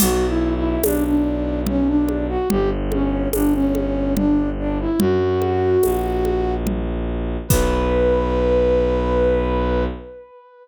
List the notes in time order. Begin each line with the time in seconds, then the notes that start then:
0.00 B1 F#4, crash, low conga
0.28 E4
0.56 E4
0.83 B1 D4, tambourine, high conga
1.05 D4
1.66 C#4, low conga
1.87 D4
2.09 high conga
2.29 F#4
2.50 G1 G4, low conga
2.92 C#4, high conga
3.33 G1 D4, tambourine, high conga
3.54 C#4
3.75 high conga
4.16 D4, low conga
4.59 D4
4.80 E4
4.99 F#2 F#4, low conga
5.42 high conga
5.83 A#1, tambourine, high conga
6.25 high conga
6.67 low conga
7.48 B1 B4, kick, crash